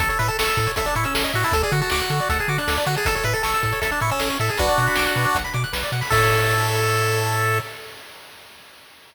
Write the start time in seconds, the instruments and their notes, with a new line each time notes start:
0.00 synth bass 1 A1, lead 1 (square) A4, kick, closed hi-hat
0.09 lead 1 (square) A4 C#5, closed hi-hat
0.19 synth bass 1 A2, lead 1 (square) B4 E5, closed hi-hat
0.28 lead 1 (square) A4 A5, closed hi-hat
0.39 synth bass 1 A1, lead 1 (square) A4 C#6, snare
0.47 lead 1 (square) E6, closed hi-hat
0.57 synth bass 1 A2, lead 1 (square) A4, kick, closed hi-hat
0.67 lead 1 (square) C#5, closed hi-hat
0.76 synth bass 1 A1, lead 1 (square) A4 E5, kick, closed hi-hat
0.86 lead 1 (square) D4 A5, closed hi-hat
0.95 synth bass 1 A2, lead 1 (square) E4 C#6, closed hi-hat
1.04 lead 1 (square) C#4 E6, closed hi-hat
1.14 synth bass 1 A1, lead 1 (square) A4, snare
1.24 lead 1 (square) D#5, closed hi-hat
1.33 synth bass 1 A2, lead 1 (square) F#4 E5, closed hi-hat
1.43 lead 1 (square) E4 A5, open hi-hat
1.52 synth bass 1 D2, lead 1 (square) A4, kick, closed hi-hat
1.62 lead 1 (square) G#4 D5, closed hi-hat
1.71 synth bass 1 D3, lead 1 (square) F#4 F#5, closed hi-hat
1.81 lead 1 (square) F#4 A5, closed hi-hat
1.90 synth bass 1 D2, lead 1 (square) F#4 D6, snare
2.00 lead 1 (square) F#6, closed hi-hat
2.10 synth bass 1 D3, lead 1 (square) A4, closed hi-hat
2.19 lead 1 (square) D5, closed hi-hat
2.29 synth bass 1 D2, lead 1 (square) A4 F#5, kick, closed hi-hat
2.39 lead 1 (square) G#4 A5, closed hi-hat
2.48 synth bass 1 D3, lead 1 (square) F#4 D6, closed hi-hat
2.58 lead 1 (square) D4 F#6, closed hi-hat
2.67 synth bass 1 D2, lead 1 (square) A4, snare
2.77 lead 1 (square) D5, closed hi-hat
2.86 synth bass 1 D3, lead 1 (square) F#4 F#5, closed hi-hat
2.95 lead 1 (square) G#4 A5, closed hi-hat
3.05 synth bass 1 A1, lead 1 (square) A4, kick, closed hi-hat
3.15 lead 1 (square) A4 C#5, closed hi-hat
3.23 synth bass 1 A2, lead 1 (square) B4 E5, closed hi-hat
3.34 lead 1 (square) A4 A5, closed hi-hat
3.43 synth bass 1 A1, lead 1 (square) A4 C#6, snare
3.54 lead 1 (square) E6, closed hi-hat
3.63 synth bass 1 A2, lead 1 (square) A4, kick, closed hi-hat
3.72 lead 1 (square) C#5, closed hi-hat
3.81 synth bass 1 A1, lead 1 (square) A4 E5, kick, closed hi-hat
3.91 lead 1 (square) D4 A5, closed hi-hat
4.00 synth bass 1 A2, lead 1 (square) E4 C#6, closed hi-hat
4.10 lead 1 (square) C#4 E6, closed hi-hat
4.20 synth bass 1 A1, lead 1 (square) A4, snare
4.30 lead 1 (square) C#5, closed hi-hat
4.39 synth bass 1 A2, lead 1 (square) A4 E5, closed hi-hat
4.49 lead 1 (square) G#4 A5, closed hi-hat
4.58 synth bass 1 B1, lead 1 (square) D4 F#4 B4, kick, closed hi-hat
4.68 lead 1 (square) D5, closed hi-hat
4.78 synth bass 1 B2, lead 1 (square) F#5, closed hi-hat
4.86 lead 1 (square) B5, closed hi-hat
4.96 synth bass 1 B1, lead 1 (square) D6, snare
5.06 lead 1 (square) F#6, closed hi-hat
5.16 synth bass 1 B2, lead 1 (square) B4, closed hi-hat
5.24 lead 1 (square) D5, closed hi-hat
5.34 synth bass 1 B1, lead 1 (square) F#5, kick, closed hi-hat
5.44 lead 1 (square) B5, closed hi-hat
5.53 synth bass 1 B2, lead 1 (square) D6, closed hi-hat
5.64 lead 1 (square) F#6, closed hi-hat
5.73 synth bass 1 B1, lead 1 (square) B4, snare
5.83 lead 1 (square) D5, closed hi-hat
5.92 synth bass 1 B2, lead 1 (square) F#5, closed hi-hat
6.01 lead 1 (square) B5, open hi-hat
6.10 synth bass 1 A2, lead 1 (square) A4 C#5 E5, kick, crash